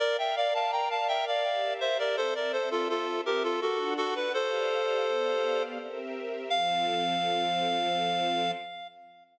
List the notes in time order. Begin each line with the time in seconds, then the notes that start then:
0.00 A#4 D5 F5
0.18 E5 G5
0.36 D5 F5
0.54 F5 A5
0.72 G5 A#5
0.90 F5 A5
1.08 E5 G5
1.27 D5 F5
1.44 G4 A#4 E5
1.81 C5 E5
1.99 A#4 D5
2.17 C4 A4 C5 E5
2.35 A#4 D5
2.52 A4 C5
2.71 F4 A4
2.89 F4 A4
3.26 G4 A#4
3.43 F4 A4
3.61 D4 F#4 A4 F#5
3.97 F#4 A4
4.15 B4
4.34 G4 A4 C5 D5 F5
5.07 B3 G4 D5 F5
5.78 C4 G4 A#4 E5
6.50 F3 C4 A4 F5